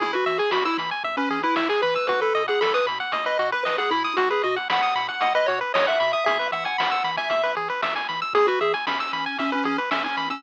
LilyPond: <<
  \new Staff \with { instrumentName = "Lead 1 (square)" } { \time 4/4 \key e \major \tempo 4 = 115 e'16 fis'8 gis'16 fis'16 e'16 r8. cis'8 e'16 e'16 gis'16 b'8 | b'16 a'8 gis'16 a'16 b'16 r8. dis''8 b'16 b'16 gis'16 e'8 | fis'16 gis'16 fis'16 r16 fis''4 fis''16 dis''16 cis''16 r16 cis''16 e''8 e''16 | e''8 fis''16 fis''4 e''8. r4. |
gis'16 fis'16 gis'16 r16 cis'4 cis'16 cis'16 cis'16 r16 cis'16 cis'8 cis'16 | }
  \new Staff \with { instrumentName = "Lead 1 (square)" } { \time 4/4 \key e \major gis'16 b'16 e''16 gis''16 b''16 e'''16 b''16 gis''16 e''16 b'16 gis'16 b'16 e''16 gis''16 b''16 e'''16 | fis'16 b'16 dis''16 fis''16 b''16 dis'''16 b''16 fis''16 dis''16 b'16 fis'16 b'16 dis''16 fis''16 b''16 dis'''16 | fis'16 b'16 dis''16 fis''16 b''16 dis'''16 b''16 fis''16 dis''16 b'16 fis'16 b'16 dis''16 fis''16 b''16 dis'''16 | gis'16 b'16 e''16 gis''16 b''16 e'''16 b''16 gis''16 e''16 b'16 gis'16 b'16 e''16 gis''16 b''16 e'''16 |
gis'16 b'16 e''16 gis''16 b''16 e'''16 b''16 gis''16 e''16 b'16 gis'16 b'16 e''16 gis''16 b''16 e'''16 | }
  \new Staff \with { instrumentName = "Synth Bass 1" } { \clef bass \time 4/4 \key e \major e,8 e8 e,8 e8 e,8 e8 e,8 e8 | b,,8 b,8 b,,8 b,8 b,,8 b,8 b,,8 b,8 | b,,8 b,8 b,,8 b,8 b,,8 b,8 b,,8 b,8 | e,8 e8 e,8 e8 e,8 e8 e,8 e8 |
e,8 e8 e,8 e8 e,8 e8 e,8 e8 | }
  \new DrumStaff \with { instrumentName = "Drums" } \drummode { \time 4/4 <hh bd>16 hh16 hh16 hh16 sn16 hh16 hh16 hh16 <hh bd>16 hh16 hh16 hh16 sn16 hh16 hh16 <hh bd>16 | <hh bd>16 hh16 hh16 hh16 sn16 hh16 hh16 hh16 <hh bd>16 hh16 hh16 hh16 sn16 hh16 hh16 hh16 | <hh bd>16 hh16 hh16 hh16 sn16 hh16 hh16 hh16 <hh bd>16 hh16 hh16 hh16 sn16 hh16 hh16 hh16 | <hh bd>16 hh16 hh16 hh16 sn16 hh16 hh16 <hh bd>16 <hh bd>16 hh16 hh16 hh16 sn16 hh16 hh16 hh16 |
<hh bd>16 hh16 hh16 hh16 sn16 hh16 hh8 <hh bd>16 hh16 hh16 hh16 sn16 hh16 hh16 <hh bd>16 | }
>>